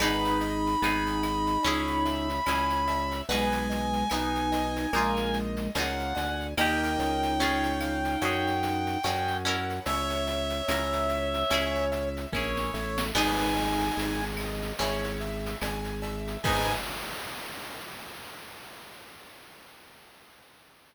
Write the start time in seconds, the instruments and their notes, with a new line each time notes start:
0.00 drawbar organ G#1, overdriven guitar B3 D#4 G#4, flute D#4, acoustic grand piano B4, clarinet B5, cowbell, claves, shaker
0.25 shaker
0.40 acoustic grand piano D#5, shaker
0.67 shaker
0.82 drawbar organ G#1, overdriven guitar B3 D#4 G#4, acoustic grand piano G#5, shaker
1.07 shaker
1.23 acoustic grand piano D#5, claves, shaker
1.47 shaker
1.63 drawbar organ C#2, overdriven guitar C#4 E4, acoustic grand piano C#5, cowbell, shaker
1.67 overdriven guitar G#4
1.87 shaker
2.05 acoustic grand piano E5, shaker
2.29 shaker
2.46 drawbar organ C#2, overdriven guitar C#4 E4 G#4, acoustic grand piano G#5, cowbell, claves, shaker
2.70 shaker
2.87 acoustic grand piano E5, cowbell, shaker
3.11 shaker
3.29 drawbar organ B1, flute G#3, overdriven guitar B3 D#4 G#4, acoustic grand piano B4, clarinet G#5, cowbell, shaker
3.52 shaker
3.70 acoustic grand piano D#5, shaker
3.93 shaker
4.10 drawbar organ B1, overdriven guitar B3 D#4, flute D#4, acoustic grand piano G#5, claves, shaker
4.14 overdriven guitar G#4
4.35 shaker
4.52 acoustic grand piano D#5, shaker
4.76 shaker
4.93 drawbar organ A#1, flute G#3, overdriven guitar A#3 D#4 F4, acoustic grand piano A#4, cowbell, claves, shaker
4.98 overdriven guitar G#4
5.17 shaker
5.33 acoustic grand piano D#5, shaker
5.57 shaker
5.75 drawbar organ C#2, overdriven guitar A#3 D#4 F4, acoustic grand piano F5, clarinet F#5, cowbell, shaker
5.80 overdriven guitar G#4
5.99 shaker
6.15 drawbar organ D2, acoustic grand piano G#5, cowbell, shaker
6.40 shaker
6.57 drawbar organ D#2, overdriven guitar A#3 D#4 G4, flute D#4, acoustic grand piano A#4 D#5 G5, clarinet G5, cowbell, claves, shaker
6.83 shaker
6.99 drawbar organ C#2, shaker
7.23 shaker
7.40 overdriven guitar C#4 F4 G#4, acoustic grand piano C#5, shaker
7.63 shaker
7.81 acoustic grand piano F5, claves, shaker
8.04 snare, shaker
8.21 drawbar organ F#2, overdriven guitar C#4 F#4 G#4, acoustic grand piano C#5, cowbell, shaker
8.47 shaker
8.63 acoustic grand piano F#5, shaker
8.86 snare, shaker
9.03 drawbar organ F#2, overdriven guitar C#4 F#4 G#4, acoustic grand piano G#5, cowbell, claves, shaker
9.28 shaker
9.45 overdriven guitar C#4 E4 A#4, acoustic grand piano F#5, cowbell, shaker
9.70 shaker
9.85 drawbar organ C#2, flute C#5, acoustic grand piano C#5, clarinet E5, cowbell, shaker
10.10 snare, shaker
10.27 acoustic grand piano E5, shaker
10.50 shaker
10.68 drawbar organ C#2, overdriven guitar C#4 E4 A#4, acoustic grand piano A#5, claves, shaker
10.93 shaker
11.09 acoustic grand piano E5, shaker
11.34 shaker
11.50 drawbar organ C#2, overdriven guitar C#4 E4 G#4, acoustic grand piano C#5, cowbell, claves, shaker
11.75 shaker
11.92 acoustic grand piano E5, shaker
12.17 shaker
12.33 drawbar organ A#1, overdriven guitar C#4 E4 G#4, clarinet C#5, acoustic grand piano G#5, kick, snare
12.57 snare
12.74 drawbar organ A1, acoustic grand piano E5, snare
12.98 snare
13.14 drawbar organ G#1, overdriven guitar B3 D#4 G#4, flute D#4, acoustic grand piano B4, clarinet G#5, crash, cowbell, claves
13.40 shaker
13.56 acoustic grand piano D#5, shaker
13.80 shaker
13.97 drawbar organ G#1, acoustic grand piano G#5, shaker
14.20 shaker
14.37 acoustic grand piano D#5, claves, shaker
14.62 shaker
14.79 drawbar organ G#1, overdriven guitar C#4 E4 G#4, acoustic grand piano C#5, cowbell, shaker
15.04 shaker
15.21 acoustic grand piano E5, shaker
15.46 shaker
15.61 drawbar organ G#1, acoustic grand piano G#5, cowbell, claves, shaker
15.84 shaker
16.02 acoustic grand piano E5, cowbell, shaker
16.27 shaker
16.43 drawbar organ G#2, overdriven guitar B3 D#4, flute G#4, acoustic grand piano B4 D#5 G#5, clarinet G#5, kick, crash
16.47 overdriven guitar G#4